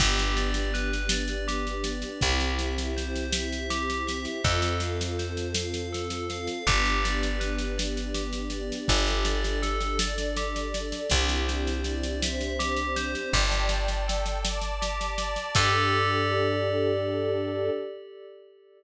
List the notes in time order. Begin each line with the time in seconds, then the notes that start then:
0.00 G1 B3 D4 G4, kick, snare, crash
0.19 snare
0.37 D5, snare
0.54 snare
0.74 B4, snare
0.93 snare
1.09 D5, snare
1.28 snare
1.48 G4, snare
1.67 snare
1.84 D5, snare
2.02 snare
2.21 C2 C4 E4 G4, kick, snare
2.40 snare
2.59 E5, snare
2.78 snare
2.97 C5, snare
3.16 snare
3.33 E5, snare
3.52 snare
3.70 G4, snare
3.90 snare
4.07 E5, snare
4.25 snare
4.44 F2 C4 F4 A4, kick, snare
4.62 snare
4.80 F5, snare
5.01 snare
5.19 C5, snare
5.37 snare
5.54 F5, snare
5.74 snare
5.93 A4, snare
6.10 snare
6.30 F5, snare
6.47 snare
6.67 G1 B3 D4 G4, kick, snare
6.85 snare
7.04 D5, snare
7.23 snare
7.40 B4, snare
7.58 snare
7.78 D5, snare
7.97 snare
8.15 G4, snare
8.33 snare
8.50 D5, snare
8.72 snare
8.88 G1 D4 G4 A4, kick, snare
9.07 snare
9.25 D5, snare
9.44 snare
9.62 A4, snare
9.81 snare
9.99 D4 A4 D5, snare
10.18 snare
10.36 G4, snare
10.56 snare
10.74 D5, snare
10.92 snare
11.10 C2 C4 D4 E4 G4, kick, snare
11.29 snare
11.48 C5, snare
11.67 snare
11.84 D5, snare
12.03 snare
12.22 C4 D4 G4 C5 E5, snare
12.41 snare
12.59 G4, snare
12.77 snare
12.96 C5, snare
13.15 snare
13.33 G1 G4 D5 G5 A5, kick, snare
13.52 snare
13.69 D5, snare
13.88 snare
14.08 A4, snare
14.26 snare
14.44 D5 A5 D6, snare
14.61 snare
14.81 G4, snare
15.01 snare
15.18 D5, snare
15.36 snare
15.55 G2 D4 G4 A4 D5, kick, crash